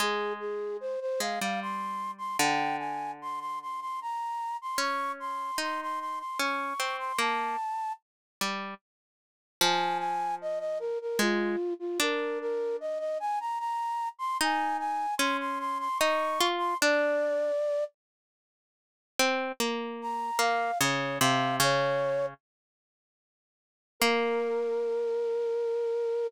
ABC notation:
X:1
M:3/4
L:1/16
Q:1/4=75
K:Fdor
V:1 name="Flute"
A2 A2 c c f f c'3 c' | g2 a2 c' c' c' c' b3 c' | _d'2 c'2 c' c' c' c' d'3 c' | =a4 z8 |
a2 a2 e e B B F3 F | B2 B2 e e a b b3 c' | a2 a2 c' c' c' c' _d'3 c' | d6 z6 |
[K:Bbdor] z4 b2 f2 d2 f2 | d4 z8 | B12 |]
V:2 name="Pizzicato Strings"
A,6 A, G,5 | D,12 | _D4 E4 D2 C2 | B,2 z4 G,2 z4 |
F,8 A,2 z2 | D12 | E4 _D4 E2 F2 | D4 z8 |
[K:Bbdor] C2 B,4 B,2 D,2 C,2 | D,4 z8 | B,12 |]